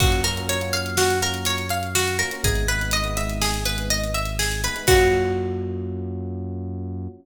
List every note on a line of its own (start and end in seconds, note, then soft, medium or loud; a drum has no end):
0.00 2.23 F#2 loud
0.00 0.20 A#3 medium
0.00 0.20 C#4 medium
0.00 0.20 F4 medium
0.00 0.20 F#4 medium
0.00 0.23 F#4 medium
0.00 kick loud
0.00 crash loud
0.12 closed hi-hat medium
0.24 0.34 A#3 medium
0.24 0.34 C#4 medium
0.24 0.34 F4 medium
0.24 0.34 F#4 medium
0.24 0.46 A#4 medium
0.24 closed hi-hat medium
0.36 0.56 A#3 medium
0.36 0.56 C#4 medium
0.36 0.56 F4 medium
0.36 0.56 F#4 medium
0.36 closed hi-hat medium
0.49 0.72 C#5 medium
0.49 closed hi-hat loud
0.61 0.71 A#3 medium
0.61 0.71 C#4 medium
0.61 0.71 F4 medium
0.61 0.71 F#4 medium
0.61 closed hi-hat medium
0.73 1.12 A#3 medium
0.73 1.12 C#4 medium
0.73 1.12 F4 medium
0.73 1.12 F#4 medium
0.73 0.95 F5 medium
0.73 closed hi-hat medium
0.86 closed hi-hat medium
0.97 1.20 F#4 medium
0.97 snare loud
1.10 closed hi-hat medium
1.22 1.61 A#3 medium
1.22 1.61 C#4 medium
1.22 1.61 F4 medium
1.22 1.61 F#4 medium
1.22 1.45 A#4 medium
1.22 closed hi-hat medium
1.34 closed hi-hat medium
1.45 1.69 C#5 medium
1.45 closed hi-hat loud
1.58 closed hi-hat medium
1.69 1.93 F5 medium
1.69 closed hi-hat medium
1.83 closed hi-hat medium
1.95 2.17 F#4 medium
1.95 snare loud
2.08 closed hi-hat medium
2.19 2.29 A#3 medium
2.19 2.29 C#4 medium
2.19 2.29 F4 medium
2.19 2.29 F#4 medium
2.19 2.41 A#4 medium
2.19 closed hi-hat medium
2.31 2.42 A#3 medium
2.31 2.42 C#4 medium
2.31 2.42 F4 medium
2.31 2.42 F#4 medium
2.31 closed hi-hat medium
2.44 4.68 G#1 loud
2.44 2.64 G#3 medium
2.44 2.64 B3 medium
2.44 2.64 D#4 medium
2.44 2.64 E4 medium
2.44 2.67 G#4 medium
2.44 kick loud
2.44 closed hi-hat loud
2.55 closed hi-hat medium
2.68 2.78 G#3 medium
2.68 2.78 B3 medium
2.68 2.78 D#4 medium
2.68 2.78 E4 medium
2.68 2.91 B4 medium
2.68 closed hi-hat medium
2.81 3.00 G#3 medium
2.81 3.00 B3 medium
2.81 3.00 D#4 medium
2.81 3.00 E4 medium
2.81 closed hi-hat medium
2.91 3.15 D#5 medium
2.91 closed hi-hat loud
3.04 3.15 G#3 medium
3.04 3.15 B3 medium
3.04 3.15 D#4 medium
3.04 3.15 E4 medium
3.04 closed hi-hat medium
3.17 3.56 G#3 medium
3.17 3.56 B3 medium
3.17 3.56 D#4 medium
3.17 3.56 E4 medium
3.17 3.39 E5 medium
3.17 closed hi-hat medium
3.29 closed hi-hat medium
3.41 3.64 G#4 medium
3.41 snare loud
3.54 closed hi-hat medium
3.65 4.04 G#3 medium
3.65 4.04 B3 medium
3.65 4.04 D#4 medium
3.65 4.04 E4 medium
3.65 3.88 B4 medium
3.65 closed hi-hat medium
3.78 closed hi-hat medium
3.90 4.13 D#5 medium
3.90 closed hi-hat medium
4.04 closed hi-hat medium
4.14 4.37 E5 medium
4.14 closed hi-hat medium
4.25 closed hi-hat medium
4.39 4.61 G#4 medium
4.39 snare loud
4.52 closed hi-hat medium
4.63 4.73 G#3 medium
4.63 4.73 B3 medium
4.63 4.73 D#4 medium
4.63 4.73 E4 medium
4.63 4.86 B4 medium
4.63 closed hi-hat medium
4.76 4.85 G#3 medium
4.76 4.85 B3 medium
4.76 4.85 D#4 medium
4.76 4.85 E4 medium
4.76 closed hi-hat medium
4.87 7.08 F#2 loud
4.87 7.08 A#3 loud
4.87 7.08 C#4 loud
4.87 7.08 F4 medium
4.87 7.07 F#4 loud
4.87 7.08 F#4 loud
4.87 kick loud
4.87 crash loud